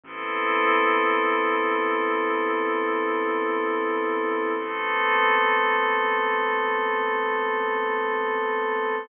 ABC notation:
X:1
M:4/4
L:1/8
Q:1/4=53
K:Ador
V:1 name="Pad 5 (bowed)"
[B,CEA]8 | [A,B,CA]8 |]
V:2 name="Synth Bass 2" clef=bass
A,,,8- | A,,,8 |]